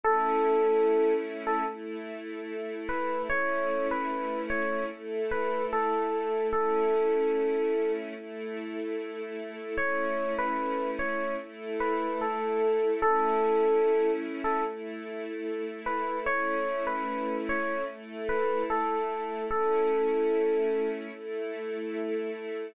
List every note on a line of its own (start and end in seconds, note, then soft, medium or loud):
0.03 1.64 A3 medium
0.03 1.64 C#4 medium
0.03 1.64 E4 medium
0.03 1.13 A4 medium
1.47 1.66 A4 medium
1.67 3.28 A3 medium
1.67 3.28 E4 medium
1.67 3.28 A4 medium
2.89 3.22 B4 medium
3.30 4.90 A3 medium
3.30 4.90 C#4 medium
3.30 4.90 E4 medium
3.30 3.88 C#5 medium
3.91 4.41 B4 medium
4.50 4.84 C#5 medium
4.91 6.52 A3 medium
4.91 6.52 E4 medium
4.91 6.52 A4 medium
5.31 5.65 B4 medium
5.73 6.47 A4 medium
6.53 8.14 A3 medium
6.53 8.14 C#4 medium
6.53 8.14 E4 medium
6.53 7.91 A4 medium
8.15 9.76 A3 medium
8.15 9.76 E4 medium
8.15 9.76 A4 medium
9.77 11.38 A3 medium
9.77 11.38 C#4 medium
9.77 11.38 E4 medium
9.77 10.34 C#5 medium
10.39 10.90 B4 medium
10.99 11.34 C#5 medium
11.40 13.01 A3 medium
11.40 13.01 E4 medium
11.40 13.01 A4 medium
11.80 12.20 B4 medium
12.21 12.92 A4 medium
13.02 14.64 A3 medium
13.02 14.64 C#4 medium
13.02 14.64 E4 medium
13.02 14.11 A4 medium
14.44 14.64 A4 medium
14.65 16.25 A3 medium
14.65 16.25 E4 medium
14.65 16.25 A4 medium
15.86 16.19 B4 medium
16.26 17.87 A3 medium
16.26 17.87 C#4 medium
16.26 17.87 E4 medium
16.26 16.84 C#5 medium
16.87 17.36 B4 medium
17.49 17.83 C#5 medium
17.87 19.48 A3 medium
17.87 19.48 E4 medium
17.87 19.48 A4 medium
18.29 18.63 B4 medium
18.70 19.44 A4 medium
19.50 21.11 A3 medium
19.50 21.11 C#4 medium
19.50 21.11 E4 medium
19.50 20.89 A4 medium
21.13 22.74 A3 medium
21.13 22.74 E4 medium
21.13 22.74 A4 medium